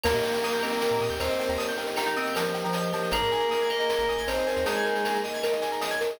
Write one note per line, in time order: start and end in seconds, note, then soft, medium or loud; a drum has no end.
0.04 0.14 D#2 medium
0.04 1.05 A#3 loud
0.04 3.09 A#3 medium
0.04 0.58 A#3 medium
0.04 3.09 D#4 medium
0.04 3.09 G4 medium
0.04 1.05 A#4 loud
0.04 0.13 A#4 medium
0.04 0.43 A#4 medium
0.04 crash loud
0.04 cowbell medium
0.04 claves medium
0.14 0.22 A#2 medium
0.14 0.23 D#5 medium
0.14 shaker medium
0.23 1.02 G5 medium
0.23 0.33 G5 medium
0.23 shaker medium
0.33 0.42 A#5 medium
0.33 shaker medium
0.43 0.81 A#4 medium
0.43 0.53 D#6 medium
0.43 shaker medium
0.53 0.62 G6 medium
0.53 shaker medium
0.63 1.14 C4 medium
0.63 0.72 A#4 medium
0.63 1.20 D#5 medium
0.63 claves medium
0.63 shaker medium
0.72 0.81 D#5 medium
0.72 shaker medium
0.81 1.39 A#4 medium
0.81 0.90 G5 medium
0.81 cowbell medium
0.81 shaker loud
0.91 1.00 A#2 medium
0.91 1.00 A#5 medium
0.91 shaker medium
1.01 1.10 A#2 medium
1.01 1.77 G5 medium
1.01 1.10 D#6 medium
1.01 shaker medium
1.10 1.19 D#2 medium
1.10 1.19 G6 medium
1.10 shaker medium
1.20 1.29 D#2 medium
1.20 1.52 C4 medium
1.20 1.29 A#4 medium
1.20 1.52 C5 loud
1.20 2.15 D#5 medium
1.20 cowbell medium
1.20 claves medium
1.20 shaker medium
1.29 1.39 D#5 medium
1.29 shaker medium
1.39 1.59 A#4 medium
1.39 1.48 G5 medium
1.39 cowbell medium
1.39 shaker medium
1.49 1.58 D#2 medium
1.49 1.58 A#5 medium
1.49 shaker medium
1.58 1.96 A#4 medium
1.58 1.67 D#6 medium
1.58 cowbell medium
1.58 shaker medium
1.69 1.77 G6 medium
1.69 shaker medium
1.78 1.86 A#4 medium
1.78 2.54 G5 medium
1.78 shaker medium
1.86 1.96 D#5 medium
1.86 shaker medium
1.96 2.06 D#4 medium
1.96 2.35 A#4 medium
1.96 2.06 G5 medium
1.96 claves medium
1.96 shaker loud
2.06 2.15 D#4 medium
2.06 2.15 A#5 medium
2.06 shaker medium
2.15 2.34 C4 medium
2.15 2.74 D#5 medium
2.15 2.25 D#6 medium
2.15 shaker medium
2.26 2.35 G6 medium
2.26 shaker medium
2.35 2.62 F3 medium
2.35 2.92 A#4 medium
2.35 2.44 A#4 medium
2.35 cowbell medium
2.35 claves medium
2.35 shaker loud
2.45 2.54 D#5 medium
2.45 shaker medium
2.54 3.09 G5 medium
2.54 2.63 G5 medium
2.54 shaker medium
2.64 2.91 F3 medium
2.64 2.73 A#5 medium
2.64 shaker medium
2.73 3.11 D#5 medium
2.73 2.83 D#6 medium
2.73 cowbell medium
2.73 shaker medium
2.83 2.92 G6 medium
2.83 shaker medium
2.92 3.11 F3 medium
2.92 3.11 A#4 medium
2.92 3.02 A#4 medium
2.92 cowbell medium
2.92 shaker medium
3.03 3.12 D#5 medium
3.03 shaker medium
3.11 3.21 G#1 medium
3.11 4.13 A#3 loud
3.11 6.17 A#3 medium
3.11 6.17 D#4 medium
3.11 6.17 G#4 medium
3.11 3.69 G#4 medium
3.11 4.13 A#4 loud
3.11 3.51 A#4 medium
3.11 3.21 A#4 medium
3.11 cowbell medium
3.11 claves loud
3.11 shaker medium
3.22 3.31 G#2 medium
3.22 3.31 D#5 medium
3.22 shaker medium
3.31 3.41 G#5 medium
3.31 4.08 G#5 medium
3.31 shaker medium
3.40 3.50 A#5 medium
3.40 shaker medium
3.51 3.89 A#4 medium
3.51 3.60 D#6 medium
3.51 shaker medium
3.61 3.69 G#6 medium
3.61 shaker medium
3.69 3.79 A#4 medium
3.69 4.26 D#5 medium
3.69 4.27 D#5 medium
3.69 claves medium
3.69 shaker medium
3.79 3.89 D#5 medium
3.79 snare soft
3.79 shaker medium
3.89 4.47 A#4 medium
3.89 3.98 G#5 medium
3.89 cowbell medium
3.89 shaker loud
3.99 4.07 G#1 medium
3.99 4.08 A#5 medium
3.99 shaker medium
4.08 4.17 G#1 medium
4.08 4.85 G#5 medium
4.08 4.18 D#6 medium
4.08 shaker medium
4.18 4.27 G#1 medium
4.18 4.27 G#6 medium
4.18 shaker medium
4.27 4.37 G#1 medium
4.27 4.61 C4 medium
4.27 4.37 A#4 medium
4.27 4.61 C5 loud
4.27 5.23 D#5 medium
4.27 cowbell medium
4.27 claves medium
4.27 shaker loud
4.38 4.47 D#5 medium
4.38 shaker medium
4.47 4.65 A#4 medium
4.47 4.56 G#5 medium
4.47 cowbell medium
4.47 shaker medium
4.56 4.65 D#2 medium
4.56 4.65 A#5 medium
4.56 shaker medium
4.65 5.17 G#3 loud
4.65 5.03 D#4 medium
4.65 5.17 G#4 loud
4.65 5.04 A#4 medium
4.65 4.75 D#6 medium
4.65 cowbell loud
4.65 shaker loud
4.75 4.85 G#6 medium
4.75 shaker medium
4.85 4.94 A#4 medium
4.85 5.61 G#5 medium
4.85 shaker medium
4.95 5.04 D#5 medium
4.95 shaker medium
5.05 5.43 A#4 medium
5.05 5.14 G#5 medium
5.05 claves medium
5.05 shaker loud
5.14 5.23 A#5 medium
5.14 shaker medium
5.24 5.81 D#5 medium
5.24 5.33 D#6 medium
5.24 shaker medium
5.34 5.42 G#6 medium
5.34 shaker medium
5.43 6.00 A#4 medium
5.43 5.52 A#4 medium
5.43 cowbell medium
5.43 claves medium
5.43 shaker medium
5.52 5.61 D#5 medium
5.52 shaker medium
5.61 6.16 G#5 medium
5.61 5.71 G#5 medium
5.61 shaker medium
5.72 5.80 A#5 medium
5.72 shaker medium
5.81 6.18 D#5 medium
5.81 5.90 D#6 medium
5.81 cowbell medium
5.81 shaker loud
5.91 6.00 G#6 medium
5.91 shaker medium
6.01 6.19 A#4 medium
6.01 6.10 A#4 medium
6.01 cowbell medium
6.01 shaker medium
6.09 6.19 D#5 medium
6.09 shaker medium